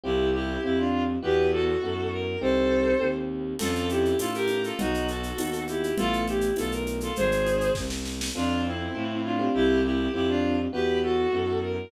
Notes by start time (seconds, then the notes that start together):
0.04 C2 C4 E4 F4 G4
0.33 E4 G4
0.63 F2 C4 E4 F4 G4
0.78 D4 F4
1.22 E2 B3 E4 F#4 G4 B4
1.52 F#4 A4
1.81 F#2 B3 E4 F#4
2.12 A#4
2.40 C2 C4 D#4 G4 A4 C5
3.00 D#2 C4 D#4 G4
3.59 F2 C#4 F4 A4, crash, low conga, shaker
3.75 shaker
3.89 E4 G4, shaker
4.05 shaker
4.19 A2 C#4 F4 A4, tambourine, high conga, shaker
4.34 G4 A#4, shaker
4.48 high conga, shaker
4.64 F4 A4, shaker
4.79 B1 B3 D#4 F#4, low conga, shaker
4.94 shaker
5.08 F#4 A4, shaker
5.23 shaker
5.38 D#2 B3 D#4 F#4, tambourine, high conga, shaker
5.53 shaker
5.68 E4 G4, high conga, shaker
5.84 shaker
5.98 A1 A3 B3 E4 F4 A4, low conga, shaker
6.13 shaker
6.27 E4 G4, high conga, shaker
6.41 shaker
6.56 B1 A3 B3 E4 F4 A4, tambourine, high conga, shaker
6.72 A#4, shaker
6.86 high conga, shaker
7.00 F4 A4, shaker
7.16 G#1 G#4 C5, low conga, shaker
7.32 shaker
7.46 high conga, shaker
7.61 shaker
7.75 C2, kick, snare
7.90 snare
8.06 snare
8.21 snare
8.35 F2 C4 D4 F4 A4
8.65 C4 E4
8.95 A2 C4 F4 A4
9.24 D4 F4
9.39 C4 F4 G4
9.54 C2 E4 G4
9.84 E4 G4
10.13 F2 C4 E4 F4 G4
10.28 D4 F4
10.73 E2 B3 E4 F#4 G4 B4
11.03 F#4 A4
11.32 F#2 B3 E4 F#4
11.62 A#4